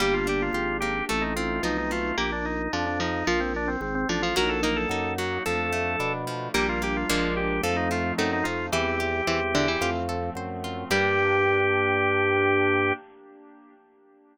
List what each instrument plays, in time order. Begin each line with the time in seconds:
0.00 drawbar organ G1 G4, harpsichord G3, pad 5 (bowed) A#3 D4 G4, acoustic guitar (steel) A#3
0.14 drawbar organ F4
0.27 acoustic guitar (steel) D4, drawbar organ G4
0.42 drawbar organ F4
0.53 drawbar organ G#1 F4, acoustic guitar (steel) G4
0.80 acoustic guitar (steel) A#3, drawbar organ G4
1.09 drawbar organ A1 A4, acoustic guitar (steel) A3, pad 5 (bowed) A3 C4 D#4
1.22 drawbar organ D#4
1.36 acoustic guitar (steel) C4, drawbar organ F4
1.63 drawbar organ B1 D#4, harpsichord F3, acoustic guitar (steel) D#4
1.78 drawbar organ D#4
1.91 acoustic guitar (steel) A3, drawbar organ F4
2.17 drawbar organ A#1 G4, harpsichord A#3
2.32 drawbar organ D4
2.45 drawbar organ D#4
2.73 drawbar organ F2 D4, harpsichord F3
2.86 drawbar organ D4
3.00 harpsichord F3, drawbar organ D#4
3.27 drawbar organ A#1 F4, harpsichord F3
3.40 drawbar organ C4
3.56 drawbar organ D4
3.68 drawbar organ C4
3.81 drawbar organ G#1 C4
3.95 drawbar organ C4
4.09 drawbar organ A1 D4, harpsichord F3
4.22 harpsichord F3, drawbar organ F4
4.36 drawbar organ A#1 A#4, acoustic guitar (steel) F#3, pad 5 (bowed) F#3 A#3 D#4, harpsichord F#4
4.49 drawbar organ A4
4.63 acoustic guitar (steel) A#3, harpsichord D#4, drawbar organ A#4
4.76 drawbar organ A4
4.89 drawbar organ F#2 A4, acoustic guitar (steel) D#4
5.18 acoustic guitar (steel) F#3, drawbar organ F#4
5.45 drawbar organ F2 A4, pad 5 (bowed) F3 A3 D4, acoustic guitar (steel) F3
5.73 acoustic guitar (steel) A3
5.99 drawbar organ B2, acoustic guitar (steel) D4
6.27 acoustic guitar (steel) F3
6.54 drawbar organ A#1 G4, acoustic guitar (steel) G3, pad 5 (bowed) G3 A#3 D4, harpsichord A#3
6.69 drawbar organ F4
6.82 acoustic guitar (steel) A#3, drawbar organ G4
6.97 drawbar organ F4
7.10 drawbar organ A#1 F4, acoustic guitar (steel) F3 G#3 A#3 D4, pad 5 (bowed) F3 G#3 A#3 D4
7.37 drawbar organ G4
7.63 drawbar organ F2 A4, acoustic guitar (steel) F3, pad 5 (bowed) F3 A3 C4 D#4
7.76 drawbar organ D#4
7.91 acoustic guitar (steel) A3, drawbar organ F4
8.18 drawbar organ F#2 D#4, harpsichord A3, acoustic guitar (steel) C4
8.33 drawbar organ D#4
8.44 drawbar organ F2 F4, acoustic guitar (steel) D#4
8.72 drawbar organ E2 G4, harpsichord E3, pad 5 (bowed) E3 G3 C4, acoustic guitar (steel) E4
9.00 acoustic guitar (steel) G4
9.27 drawbar organ E2, harpsichord E3, acoustic guitar (steel) C5
9.55 harpsichord D3, acoustic guitar (steel) E4
9.68 harpsichord E3
9.81 drawbar organ F2, pad 5 (bowed) F3 A3 C4, acoustic guitar (steel) F4
10.09 acoustic guitar (steel) A4
10.35 drawbar organ F#2, acoustic guitar (steel) C5
10.64 acoustic guitar (steel) F4
10.90 drawbar organ G2 G4, harpsichord G3, pad 5 (bowed) A#3 D4 G4, acoustic guitar (steel) A#3 D4 G4